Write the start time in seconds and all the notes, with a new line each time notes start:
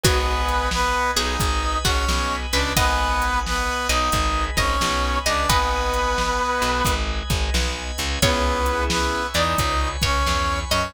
0.03 G#1 B3 F#4 B4 D#5 F#5 G#5, kick, closed hi-hat
0.48 closed hi-hat
0.71 B3 B4, snare
1.16 B1 B3 D#4 G#4 D#5, closed hi-hat
1.40 G#1 G#3 B4 D#5 G#5 B5, kick, closed hi-hat
1.84 G#1 G#3 C#4 F#4 C#5, kick, closed hi-hat
2.08 B1 B3, snare
2.53 C#2 C#3 D4 B4 D5, closed hi-hat
2.76 G#1 B3 B4 D#5 F#5 G#5, kick, closed hi-hat
3.22 closed hi-hat
3.46 B3 B4, snare
3.89 B1 B3 D#4 D#5, closed hi-hat
4.12 G#1 G#3 B4 D#5 G#5 B5, kick, closed hi-hat
4.57 G#1 G#3 C#4 C#5 D#5, kick, closed hi-hat
4.80 B1 B3, snare
5.25 C#2 C#3 D4 D5 D#5, closed hi-hat
5.49 G#1 B3 B4 D#5 F#5 G#5, kick, closed hi-hat
5.93 closed hi-hat
6.18 snare
6.62 B1 B3, closed hi-hat
6.85 G#1 G#3 B4 D#5 G#5 B5, kick, closed hi-hat
7.30 G#1 G#3, kick, closed hi-hat
7.54 B1 B3, snare
7.98 C#2 C#3, closed hi-hat
8.22 C#2 B3 C#4 E4 G#4 B4 C#5 E5 G#5, kick, closed hi-hat
8.66 closed hi-hat
8.90 B3 B4, snare
9.34 E2 E3 D#4 D5 D#5, closed hi-hat
9.58 C#2 C#3 B4 C#5 G#5 B5, kick, closed hi-hat
10.02 C#2 C#3 C#4 C#5, kick, closed hi-hat
10.26 E2 E3, snare
10.70 F#2 F#3 C#4 C#5 D#5, closed hi-hat